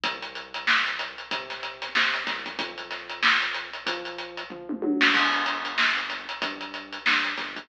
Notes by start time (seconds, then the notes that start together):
0.03 C2, kick, closed hi-hat
0.22 closed hi-hat
0.35 closed hi-hat
0.54 closed hi-hat
0.67 snare
0.86 closed hi-hat
0.99 closed hi-hat
1.18 closed hi-hat
1.31 C3, kick, closed hi-hat
1.50 snare, closed hi-hat
1.63 closed hi-hat
1.82 snare, closed hi-hat
1.95 C3, snare
2.14 snare, closed hi-hat
2.27 C2, kick, snare, closed hi-hat
2.46 kick, closed hi-hat
2.59 F2, kick, closed hi-hat
2.78 closed hi-hat
2.91 snare, closed hi-hat
3.09 closed hi-hat
3.23 snare
3.42 closed hi-hat
3.54 closed hi-hat
3.73 closed hi-hat
3.86 F3, kick, closed hi-hat
4.05 closed hi-hat
4.18 closed hi-hat
4.37 closed hi-hat
4.50 F3, kick, floor tom
4.69 mid tom
4.82 F#3, high tom
5.01 snare
5.14 G1, kick, crash
5.33 closed hi-hat
5.46 closed hi-hat
5.65 closed hi-hat
5.78 snare
5.97 closed hi-hat
6.10 snare, closed hi-hat
6.29 closed hi-hat
6.42 G2, kick, closed hi-hat
6.61 closed hi-hat
6.74 closed hi-hat
6.92 closed hi-hat
7.06 G2, snare
7.24 closed hi-hat
7.37 G1, kick, snare, closed hi-hat
7.56 kick, closed hi-hat